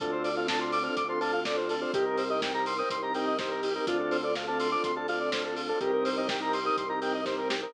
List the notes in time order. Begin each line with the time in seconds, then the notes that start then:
0.00 D2 C4 D4 F4 A4, kick, closed hi-hat
0.12 C5
0.24 D5, open hi-hat
0.36 C4 D4 F4 A4 F5
0.47 C4 D4 F4 A4 A5, kick, snare
0.59 C4 D4 F4 A4 C6
0.72 D6, open hi-hat
0.83 C4 D4 F4 A4 F6
0.97 D2 D6, kick, closed hi-hat
1.09 C4 D4 F4 A4 C6
1.20 C4 D4 F4 A4 A5, open hi-hat
1.33 F5
1.45 C4 D4 F4 A4 D5, kick, snare
1.57 C5
1.69 A4, open hi-hat
1.81 C4 D4 F4 A4 C5
1.94 C2 C4 D#4 G4 A#4, kick, closed hi-hat
2.05 A#4
2.18 C5, open hi-hat
2.30 C4 D#4 G4 A#4 D#5
2.42 C4 D#4 G4 A#4 G5, kick, snare
2.54 C4 D#4 G4 A#4 A#5
2.66 C6, open hi-hat
2.78 C4 D#4 G4 A#4 D#6
2.90 C2 C6, kick, closed hi-hat
3.02 C4 D#4 G4 A#4 A#5
3.14 C4 D#4 G4 A#4 G5, open hi-hat
3.27 D#5
3.39 C4 D#4 G4 A#4 C5, kick, snare
3.51 A#4
3.63 G4, open hi-hat
3.75 C4 D#4 G4 A#4
3.87 D2 C4 D4 F4 A4, kick, closed hi-hat
3.99 A4
4.11 C5, open hi-hat
4.23 C4 D4 F4 A4 D5
4.35 C4 D4 F4 A4 F5, kick, snare
4.47 C4 D4 F4 A4 A5
4.60 C6, open hi-hat
4.71 C4 D4 F4 A4 D6
4.84 D2 C6, kick, closed hi-hat
4.96 C4 D4 F4 A4 A5
5.08 C4 D4 F4 A4 F5, open hi-hat
5.20 D5
5.32 C4 D4 F4 A4 C5, kick, snare
5.44 A4
5.56 F4, open hi-hat
5.69 C4 D4 F4 A4
5.80 C2 C4 D#4 G4 A#4, kick, closed hi-hat
5.93 A#4
6.05 C5, open hi-hat
6.17 C4 D#4 G4 A#4 D#5
6.28 C4 D#4 G4 A#4 G5, kick, snare
6.40 C4 D#4 G4 A#4 A#5
6.53 C6, open hi-hat
6.65 C4 D#4 G4 A#4 D#6
6.77 C2 C6, kick, closed hi-hat
6.89 C4 D#4 G4 A#4 A#5
7.01 C4 D#4 G4 A#4 G5, open hi-hat
7.14 D#5
7.25 C4 D#4 G4 A#4 C5, kick, snare
7.38 A#4
7.50 G4, snare
7.62 C4 D#4 G4 A#4